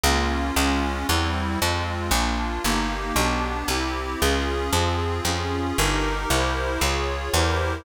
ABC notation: X:1
M:3/4
L:1/8
Q:1/4=115
K:Fm
V:1 name="Accordion"
[B,DF]2 [A,DF]2 [G,C=E]2 | [A,CF]2 [B,=DF]2 [B,EG]2 | [=B,=DG]2 [C=EG]2 [_DFA]2 | [CFA]2 [DFA]2 [EGB]2 |
[=EGBc]2 [FAd]2 [EGBc]2 |]
V:2 name="Electric Bass (finger)" clef=bass
D,,2 D,,2 =E,,2 | F,,2 B,,,2 G,,,2 | =B,,,2 C,,2 D,,2 | F,,2 F,,2 G,,,2 |
C,,2 D,,2 =E,,2 |]